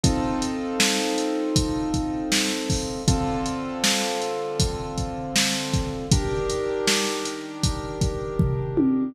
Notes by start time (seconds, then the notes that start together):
0.03 C4 D#4 F4 A4, kick, closed hi-hat
0.42 closed hi-hat
0.80 snare
1.18 closed hi-hat
1.56 kick, closed hi-hat
1.94 kick, closed hi-hat
2.32 snare
2.70 kick, open hi-hat
3.08 D3 C4 F4 A4, kick, closed hi-hat
3.46 closed hi-hat
3.84 snare
4.22 closed hi-hat
4.60 kick, closed hi-hat
4.98 kick, closed hi-hat
5.36 snare
5.74 kick, closed hi-hat
6.12 D#3 D4 G4 A#4, kick, closed hi-hat
6.50 closed hi-hat
6.88 snare
7.25 closed hi-hat
7.63 kick, closed hi-hat
8.01 kick, closed hi-hat
8.39 kick, floor tom
8.77 high tom